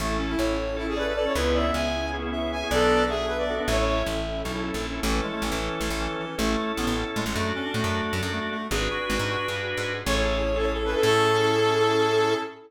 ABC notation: X:1
M:7/8
L:1/16
Q:1/4=155
K:A
V:1 name="Brass Section"
z3 E3 z2 E G B B A c | z2 e2 g4 z4 g2 | [M:5/8] A4 G2 B d2 z | [M:7/8] c c3 z10 |
z14 | [M:5/8] z10 | [M:7/8] z14 | z14 |
[M:5/8] c z4 A z2 B A | [M:7/8] A14 |]
V:2 name="Clarinet"
A,2 C2 c4 z2 d2 d2 | B2 d2 e4 z2 e2 e2 | [M:5/8] d4 e6 | [M:7/8] e2 e6 z6 |
E,2 G, A, E,4 z2 E,2 E,2 | [M:5/8] A,4 B,2 z2 G, G, | [M:7/8] A,2 C D A,4 z2 A,2 A,2 | G2 F4 F2 z6 |
[M:5/8] c6 c A2 A | [M:7/8] A14 |]
V:3 name="Drawbar Organ"
[CEA]8 [CEA] [CEA] [CEA]3 [CEA] | [B,CEG]8 [B,CEG] [B,CEG] [B,CEG]3 [B,CEG] | [M:5/8] [B,DFA]8 [B,DFA] [B,DFA] | [M:7/8] [CEA]8 [CEA] [CEA] [CEA]3 [CEA] |
[CEA]14 | [M:5/8] [CEA]10 | [M:7/8] [DFA]14 | [DFGB]14 |
[M:5/8] [CEGA]5 [CEGA]3 [CEGA] [CEGA] | [M:7/8] [CEGA]14 |]
V:4 name="Electric Bass (finger)" clef=bass
A,,,4 A,,,10 | C,,4 C,,10 | [M:5/8] B,,,10 | [M:7/8] A,,,4 A,,,4 B,,,3 ^A,,,3 |
A,,,4 A,,, A,,,3 A,,, A,,,5 | [M:5/8] A,,,4 A,,, A,,,3 A,, A,,, | [M:7/8] F,,4 A,, F,,3 F,, F,,5 | G,,,4 G,,, G,,3 =G,,3 ^G,,3 |
[M:5/8] A,,,10 | [M:7/8] A,,14 |]
V:5 name="Pad 5 (bowed)"
[CEA]14 | [B,CEG]14 | [M:5/8] [B,DFA]10 | [M:7/8] [CEA]14 |
z14 | [M:5/8] z10 | [M:7/8] z14 | z14 |
[M:5/8] [CEGA]10 | [M:7/8] [CEGA]14 |]